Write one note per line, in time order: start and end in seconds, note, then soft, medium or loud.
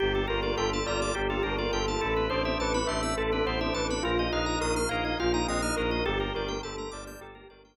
0.00 0.25 G1 loud
0.00 2.00 A#3 loud
0.00 2.00 D4 loud
0.00 0.13 G4 loud
0.00 0.25 G4 loud
0.00 0.26 G4 medium
0.00 2.00 G4 loud
0.00 2.00 A4 loud
0.15 0.28 A4 medium
0.28 0.54 G1 medium
0.28 0.80 F4 loud
0.28 0.41 A#4 loud
0.28 0.57 A#4 medium
0.43 0.56 D5 medium
0.57 0.82 G1 loud
0.57 0.84 A4 medium
0.57 0.70 G5 medium
0.73 0.86 A5 medium
0.86 1.11 G1 medium
0.86 1.13 F4 loud
0.86 1.13 D5 medium
0.86 1.00 A#5 medium
1.02 1.15 D6 medium
1.15 1.41 G1 loud
1.15 1.28 G4 loud
1.15 1.42 G4 medium
1.30 1.44 F4 loud
1.30 1.43 A4 medium
1.43 1.69 G1 loud
1.43 1.58 D4 loud
1.43 1.56 A#4 medium
1.43 1.73 A#4 medium
1.58 1.72 F4 loud
1.58 1.71 D5 medium
1.72 1.96 G1 loud
1.72 1.87 F4 loud
1.72 2.00 A4 medium
1.72 1.86 G5 medium
1.87 2.01 F4 loud
1.87 2.01 A5 medium
2.01 2.27 A1 loud
2.01 4.03 B3 loud
2.01 4.03 C4 loud
2.01 2.27 E4 loud
2.01 4.03 E4 loud
2.01 2.14 A4 loud
2.01 2.28 A4 medium
2.01 4.03 A4 loud
2.16 2.29 B4 medium
2.30 2.55 A1 loud
2.30 2.77 D4 loud
2.30 2.43 C5 medium
2.30 2.57 C5 medium
2.45 2.58 E5 medium
2.58 2.83 A1 loud
2.58 2.88 B4 medium
2.58 2.73 A5 medium
2.74 2.87 B5 medium
2.87 3.13 A1 loud
2.87 3.14 D4 loud
2.87 3.14 E5 medium
2.87 3.01 C6 medium
3.03 3.16 E6 medium
3.16 3.41 A1 medium
3.16 3.31 A4 medium
3.16 3.44 A4 medium
3.32 3.46 D4 loud
3.32 3.46 B4 medium
3.46 3.70 A1 medium
3.46 3.60 B3 loud
3.46 3.73 C5 medium
3.46 3.60 C5 loud
3.61 3.75 D4 loud
3.61 3.74 E5 medium
3.74 3.99 A1 medium
3.74 3.89 D4 loud
3.74 4.02 B4 medium
3.74 3.87 A5 loud
3.89 4.03 D4 loud
3.89 4.03 B5 medium
4.03 4.28 A#1 loud
4.03 6.05 A#3 loud
4.03 6.05 D#4 medium
4.03 4.29 F4 medium
4.03 4.27 F4 loud
4.03 6.05 F4 loud
4.03 4.18 A#4 loud
4.19 4.32 D#5 medium
4.32 4.57 A#1 loud
4.32 4.79 D#4 loud
4.32 4.59 D#5 medium
4.32 4.45 F5 medium
4.46 4.59 A#5 medium
4.61 4.86 A#1 medium
4.61 4.88 A#4 medium
4.61 4.74 D#6 medium
4.76 4.89 F6 medium
4.89 5.14 A#1 medium
4.89 5.19 D#4 loud
4.89 5.04 A#4 medium
4.89 5.16 F5 medium
5.05 5.18 D#5 medium
5.20 5.45 A#1 loud
5.20 5.46 F4 medium
5.20 5.33 F5 medium
5.34 5.47 D#4 loud
5.34 5.47 A#5 medium
5.47 5.72 A#1 loud
5.47 5.62 C4 loud
5.47 5.76 D#5 medium
5.47 5.61 D#6 medium
5.62 5.76 D#4 loud
5.62 5.75 F6 loud
5.77 6.01 A#1 loud
5.77 5.91 D#4 loud
5.77 6.03 A#4 medium
5.77 5.91 A#4 medium
5.91 6.05 D#4 medium
5.91 6.04 D#5 medium
6.06 6.31 G1 loud
6.06 7.76 A3 medium
6.06 7.76 A#3 loud
6.06 7.76 D4 loud
6.06 6.32 G4 medium
6.06 6.59 G4 loud
6.06 7.76 G4 loud
6.06 6.19 A4 loud
6.20 6.33 A#4 medium
6.35 6.60 G1 loud
6.35 6.61 A#4 medium
6.35 6.49 D5 medium
6.48 6.61 G5 medium
6.63 6.87 G1 medium
6.63 6.91 A4 medium
6.63 6.76 A5 loud
6.78 6.91 A#5 medium
6.91 7.16 G1 loud
6.91 7.20 D5 medium
6.91 7.04 D6 medium
7.07 7.20 G6 medium
7.20 7.44 G1 medium
7.20 7.48 G4 medium
7.20 7.34 A4 medium
7.35 7.48 A#4 medium
7.49 7.74 G1 medium
7.49 7.76 A#4 medium
7.49 7.63 D5 medium
7.65 7.76 G5 medium